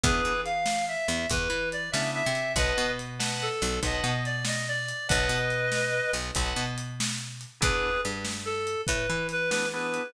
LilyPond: <<
  \new Staff \with { instrumentName = "Clarinet" } { \time 12/8 \key b \major \tempo 4. = 95 <gis' b'>4 f''4 e''4 b'4 d''8 e''8 e''4 | <b' dis''>4 r4 a'4 dis''4 d''8 dis''8 d''4 | <b' dis''>2. r2. | <gis' b'>4 r4 a'4 b'4 b'8 b'8 b'4 | }
  \new Staff \with { instrumentName = "Drawbar Organ" } { \time 12/8 \key b \major <b d' e' gis'>1~ <b d' e' gis'>8 <b d' e' gis'>4. | <b' dis'' fis'' a''>4. <b' dis'' fis'' a''>4. <b' dis'' fis'' a''>2. | <b' dis'' fis'' a''>2. <b' dis'' fis'' a''>2. | <b d' e' gis'>1~ <b d' e' gis'>8 <b d' e' gis'>8 <b d' e' gis'>4 | }
  \new Staff \with { instrumentName = "Electric Bass (finger)" } { \clef bass \time 12/8 \key b \major e,8 e2 e,8 e,8 e4 cis8. c8. | b,,8 b,2 b,,8 b,,8 b,2~ b,8 | b,,8 b,2 b,,8 b,,8 b,2~ b,8 | e,4 g,2 a,8 e2~ e8 | }
  \new DrumStaff \with { instrumentName = "Drums" } \drummode { \time 12/8 <hh bd>4 hh8 sn4 hh8 <hh bd>4 hh8 sn4 hh8 | <hh bd>4 hh8 sn4 hh8 <hh bd>4 hh8 sn4 hh8 | <hh bd>4 hh8 sn4 hh8 <hh bd>4 hh8 sn4 hh8 | <hh bd>4 hh8 sn4 hh8 <hh bd>4 hh8 sn4 hh8 | }
>>